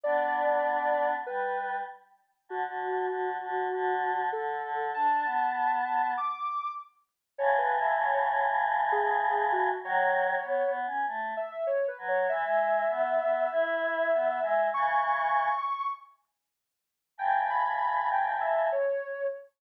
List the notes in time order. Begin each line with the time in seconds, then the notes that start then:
0.03 B3 D4 D5
1.26 G3 B4
2.49 D3 F#4
2.66 D3
3.09 D3
3.43 D3
3.73 D3
4.32 D3 A4
4.63 D3
4.94 D4 A5
5.24 B3
6.17 D6
7.38 A2 C#3 C#5
7.58 B4
7.81 E5
8.01 C#5
8.14 C#5
8.92 G#4
9.52 F#4
9.83 D#3 F#3 C#5
10.43 B3
10.67 B3
10.86 C#4
11.07 A3
11.37 E5
11.51 E5
11.67 C#5
11.88 B4
11.98 F#3
12.08 C#5
12.29 E3 E5
12.44 G#3
12.90 B3
13.20 B3
13.52 E4
14.13 B3
14.42 G#3
14.74 C#3 E3 C#6
17.18 A2 C#3 G5
17.50 B5
18.11 G5
18.41 E5
18.72 C#5